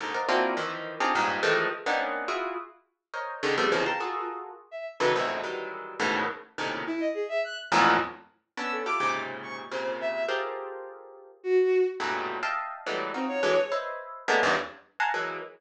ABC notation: X:1
M:3/4
L:1/16
Q:1/4=105
K:none
V:1 name="Orchestral Harp"
[^G,,^A,,C,D,^D,] [^Ac=d^df^f] [^A,C=DE=F^F]2 [^D,E,=F,]3 [C=D^D=F=G^G] [=G,,^G,,A,,]2 [D,E,F,=G,^G,=A,]2 | z [^A,B,C^CD^D]3 [EF^F^G]2 z4 [^A=c^c^d]2 | [^C,D,^D,] [F,G,A,B,=C] [B,,=C,^C,D,E,F,] [fga^a=c'^c'] [F^F^G=A^A]4 z3 [C,=D,^D,E,^F,] | [E,,F,,^F,,^G,,A,,B,,]2 [^D,E,^F,=G,^G,]4 [G,,A,,B,,^C,D,E,]2 z2 [A,,^A,,=C,^C,D,]2 |
z6 [E,,F,,^F,,^G,,A,,^A,,]2 z4 | [B,^CD]2 [EFGA] [^G,,^A,,=C,^C,]5 [A,,=C,^C,]4 | [FG^GA^Ac]8 z4 | [^F,,G,,A,,^A,,B,,^C,]3 [^de=fg=a]3 [E,^F,G,^G,A,B,]2 [^D=F^F]2 [=D,E,F,G,] z |
[Bc^c^de]4 [^G,A,^A,B,^C=D] [E,,^F,,=G,,^G,,] z3 [=f^f^g=a^a=c'] [E,^F,G,A,]2 |]
V:2 name="Violin"
z10 A z | z12 | ^G3 a F2 z3 e z B | z12 |
E ^d ^G e ^f' z7 | e' A d'2 z2 ^c' z =c2 e2 | z8 ^F3 z | z8 C ^c3 |
z12 |]